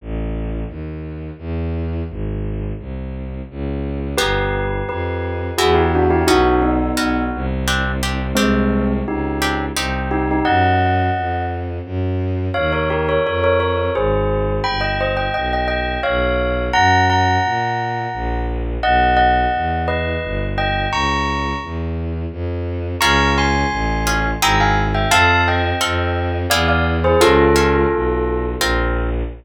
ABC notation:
X:1
M:3/4
L:1/16
Q:1/4=86
K:Bbmix
V:1 name="Tubular Bells"
z12 | z12 | [G=B]4 [GB]4 [^FA] [=EG] [DF] [EG] | [E_G]2 [_CE]4 z6 |
[A,C]4 [EG]4 z2 [EG] [EG] | [e_g]6 z6 | [K:Ebmix] [df] [Bd] [GB] [Bd] [Bd] [Bd] [Bd]2 [Ac]4 | [g=b] [eg] [ce] [eg] [eg] [eg] [eg]2 [df]4 |
[_gb]2 [gb]8 z2 | [e_g]2 [eg]4 [_ce]4 [e=g]2 | [bd']4 z8 | [K:Bbmix] [b_d']2 [ac']6 [gb] [fa] z [=eg] |
[f=a]2 [eg]6 [df] [df] z [^Gc] | [F=A]8 z4 |]
V:2 name="Orchestral Harp"
z12 | z12 | [=B,^DG]8 [B,=E^F]4 | [_C_D_G]4 [CDG]4 [=C=D=G]2 [CDG]2 |
[CDG]6 [CDG]2 [CEG]4 | z12 | [K:Ebmix] z12 | z12 |
z12 | z12 | z12 | [K:Bbmix] [_DFA]6 [DFA]2 [C=EA]4 |
[CF=A]4 [CFA]4 [=B,=E^G]4 | [_DF=A]2 [DFA]6 [CFB]4 |]
V:3 name="Violin" clef=bass
=A,,,4 E,,4 =E,,4 | A,,,4 C,,4 _D,,4 | G,,,4 F,,4 =E,,4 | _C,,4 C,,2 =C,,6 |
C,,4 _D,,4 C,,4 | _G,,4 F,,4 G,,4 | [K:Ebmix] E,,4 F,,4 A,,,4 | G,,,4 =B,,,4 B,,,4 |
_G,,4 B,,4 B,,,4 | _C,,4 _F,,4 G,,,4 | D,,4 _F,,4 =F,,4 | [K:Bbmix] _D,,4 =A,,,4 _A,,,4 |
F,,4 F,,4 =E,,4 | _D,,4 =B,,,4 _B,,,4 |]